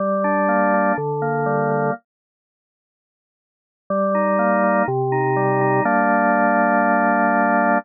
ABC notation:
X:1
M:4/4
L:1/8
Q:1/4=123
K:Gm
V:1 name="Drawbar Organ"
G, D B, D D, B, G, B, | z8 | G, E B, E C, E G, E | [G,B,D]8 |]